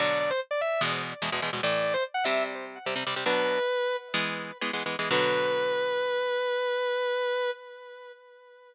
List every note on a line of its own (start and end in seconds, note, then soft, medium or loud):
0.00 0.32 B2 medium
0.00 0.32 D3 medium
0.00 0.32 F#3 medium
0.00 0.19 D5 medium
0.20 0.30 D5 medium
0.30 0.40 C5 medium
0.51 0.60 D5 medium
0.61 0.81 E5 medium
0.81 1.14 E2 medium
0.81 1.14 B2 medium
0.81 1.14 G#3 medium
1.22 1.30 E2 medium
1.22 1.30 B2 medium
1.22 1.30 G#3 medium
1.32 1.40 E2 medium
1.32 1.40 B2 medium
1.32 1.40 G#3 medium
1.42 1.50 E2 medium
1.42 1.50 B2 medium
1.42 1.50 G#3 medium
1.53 1.61 E2 medium
1.53 1.61 B2 medium
1.53 1.61 G#3 medium
1.63 1.96 A2 medium
1.63 1.96 E3 medium
1.63 1.96 A3 medium
1.63 1.83 D5 medium
1.83 1.93 D5 medium
1.94 2.03 C5 medium
2.14 2.24 F#5 medium
2.24 2.78 C3 medium
2.24 2.78 G3 medium
2.24 2.78 C4 medium
2.24 2.43 E5 medium
2.86 2.95 C3 medium
2.86 2.95 G3 medium
2.86 2.95 C4 medium
2.96 3.04 C3 medium
2.96 3.04 G3 medium
2.96 3.04 C4 medium
3.07 3.15 C3 medium
3.07 3.15 G3 medium
3.07 3.15 C4 medium
3.16 3.24 C3 medium
3.16 3.24 G3 medium
3.16 3.24 C4 medium
3.26 3.59 B2 medium
3.26 3.59 F#3 medium
3.26 3.59 D4 medium
3.26 3.96 B4 medium
4.14 4.52 E3 medium
4.14 4.52 G#3 medium
4.14 4.52 B3 medium
4.61 4.71 E3 medium
4.61 4.71 G#3 medium
4.61 4.71 B3 medium
4.73 4.83 E3 medium
4.73 4.83 G#3 medium
4.73 4.83 B3 medium
4.86 4.96 E3 medium
4.86 4.96 G#3 medium
4.86 4.96 B3 medium
4.99 5.09 E3 medium
4.99 5.09 G#3 medium
4.99 5.09 B3 medium
5.11 7.50 B2 medium
5.11 7.50 D3 medium
5.11 7.50 F#3 loud
5.11 7.50 B4 loud